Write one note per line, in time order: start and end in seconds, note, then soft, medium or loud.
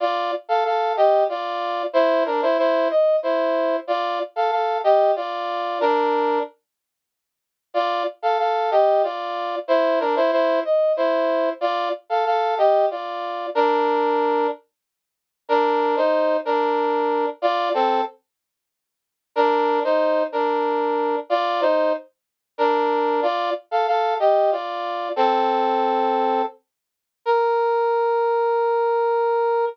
0.00 0.31 F4 medium
0.00 0.31 D5 medium
0.49 0.64 A4 medium
0.49 0.64 F5 medium
0.65 0.93 A4 medium
0.65 0.93 F5 medium
0.97 1.24 G4 medium
0.97 1.24 D#5 medium
1.29 1.83 F4 medium
1.29 1.83 D5 medium
1.93 2.24 E4 medium
1.93 2.24 C5 loud
2.26 2.41 D4 medium
2.26 2.41 A#4 medium
2.42 2.57 E4 medium
2.42 2.57 C5 medium
2.58 2.88 E4 medium
2.58 2.88 C5 medium
2.90 3.16 D#5 medium
3.23 3.76 E4 medium
3.23 3.76 C5 medium
3.87 4.19 F4 medium
3.87 4.19 D5 medium
4.36 4.51 A4 medium
4.36 4.51 F5 medium
4.51 4.78 A4 medium
4.51 4.78 F5 medium
4.84 5.12 G4 medium
4.84 5.12 D#5 medium
5.16 5.79 F4 medium
5.16 5.79 D5 medium
5.81 6.39 D4 medium
5.81 6.39 A#4 medium
7.74 8.03 F4 medium
7.74 8.03 D5 medium
8.22 8.38 A4 medium
8.22 8.38 F5 medium
8.39 8.70 A4 medium
8.39 8.70 F5 medium
8.71 9.02 G4 medium
8.71 9.02 D#5 medium
9.03 9.56 F4 medium
9.03 9.56 D5 medium
9.68 9.99 E4 medium
9.68 9.99 C5 medium
10.00 10.15 D4 medium
10.00 10.15 A#4 medium
10.16 10.31 E4 medium
10.16 10.31 C5 medium
10.32 10.60 E4 medium
10.32 10.60 C5 medium
10.65 10.93 D#5 medium
10.97 11.49 E4 medium
10.97 11.49 C5 medium
11.61 11.89 F4 medium
11.61 11.89 D5 medium
12.10 12.25 A4 medium
12.10 12.25 F5 medium
12.26 12.55 A4 medium
12.26 12.55 F5 medium
12.58 12.86 G4 medium
12.58 12.86 D#5 medium
12.90 13.46 F4 medium
12.90 13.46 D5 medium
13.55 14.47 D4 medium
13.55 14.47 A#4 loud
15.49 15.95 D4 medium
15.49 15.95 A#4 medium
15.97 16.37 D#4 medium
15.97 16.37 C5 medium
16.45 17.26 D4 medium
16.45 17.26 A#4 medium
17.42 17.69 F4 medium
17.42 17.69 D5 loud
17.74 18.01 C4 medium
17.74 18.01 A4 medium
19.36 19.80 D4 medium
19.36 19.80 A#4 loud
19.84 20.23 D#4 medium
19.84 20.23 C5 medium
20.32 21.16 D4 medium
20.32 21.16 A#4 medium
21.30 21.61 F4 medium
21.30 21.61 D5 loud
21.61 21.93 D#4 medium
21.61 21.93 C5 medium
22.58 23.20 D4 medium
22.58 23.20 A#4 medium
23.23 23.50 F4 medium
23.23 23.50 D5 medium
23.71 23.87 A4 medium
23.71 23.87 F5 medium
23.87 24.14 A4 medium
23.87 24.14 F5 medium
24.19 24.51 G4 medium
24.19 24.51 D#5 medium
24.52 25.09 F4 medium
24.52 25.09 D5 medium
25.16 26.42 C4 medium
25.16 26.42 A4 medium
27.25 29.65 A#4 loud